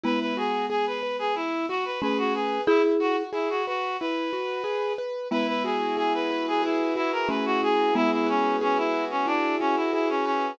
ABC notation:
X:1
M:4/4
L:1/16
Q:1/4=91
K:Emix
V:1 name="Clarinet"
B B G2 G B2 G E2 F B B F G2 | E z F z E F F2 B6 z2 | B B G2 G B2 G E2 E ^A B F G2 | E E C2 C E2 C D2 C E E C C2 |]
V:2 name="Marimba"
[G,B,]12 [A,C]4 | [EG]4 z12 | [G,B,]12 [A,C]4 | [G,B,]10 z6 |]
V:3 name="Acoustic Grand Piano"
E2 F2 G2 B2 E2 F2 G2 B2 | E2 F2 G2 B2 E2 F2 G2 B2 | E2 F2 G2 B2 G2 F2 E2 F2 | G2 B2 G2 F2 E2 F2 G2 B2 |]